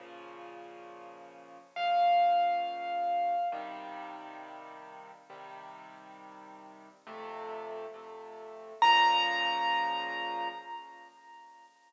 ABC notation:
X:1
M:6/8
L:1/8
Q:3/8=68
K:Bbm
V:1 name="Acoustic Grand Piano"
z6 | f6 | z6 | z6 |
z6 | b6 |]
V:2 name="Acoustic Grand Piano"
[B,,D,F,]6 | [B,,D,F,]6 | [C,E,=G,]6 | [C,E,=G,]6 |
[F,,C,=A,]3 [F,,C,A,]3 | [B,,D,F,]6 |]